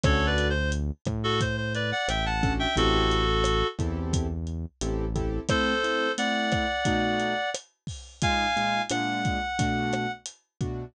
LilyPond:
<<
  \new Staff \with { instrumentName = "Clarinet" } { \time 4/4 \key a \dorian \tempo 4 = 88 \tuplet 3/2 { <a' cis''>8 <b' d''>8 c''8 } r8. <fis' a'>16 c''16 c''16 <b' d''>16 <d'' fis''>16 <e'' g''>16 <fis'' a''>8 <e'' g''>16 | <fis' a'>4. r2 r8 | <a' c''>4 <d'' fis''>2 r4 | <f'' aes''>4 fis''2 r4 | }
  \new Staff \with { instrumentName = "Acoustic Grand Piano" } { \time 4/4 \key a \dorian <cis' d' fis' a'>2.~ <cis' d' fis' a'>8 <cis' d' fis' a'>8 | <c' e' g' a'>4. <c' e' g' a'>4. <c' e' g' a'>8 <c' e' g' a'>8 | <a c' e'>8 <a c' e'>8 <a c' e'>4 <b, a dis' fis'>2 | <bes, aes ees' f'>8 <bes, aes ees' f'>8 <bes, aes d' f'>4 <b, a d' fis'>4. <b, a d' fis'>8 | }
  \new Staff \with { instrumentName = "Synth Bass 1" } { \clef bass \time 4/4 \key a \dorian d,4. a,4. a,,4 | a,,4. e,4. a,,4 | r1 | r1 | }
  \new DrumStaff \with { instrumentName = "Drums" } \drummode { \time 4/4 <hh bd ss>8 hh8 hh8 <hh bd ss>8 <hh bd>8 hh8 <hh ss>8 <hh bd>8 | <hh bd>8 hh8 <hh ss>8 <hh bd>8 <hh bd>8 hh8 hh8 <hh bd>8 | <hh bd ss>8 hh8 hh8 <hh bd ss>8 <hh bd>8 hh8 <hh ss>8 <hho bd>8 | <hh bd>8 hh8 <hh ss>8 <hh bd>8 <hh bd>8 <hh ss>8 hh8 <hh bd>8 | }
>>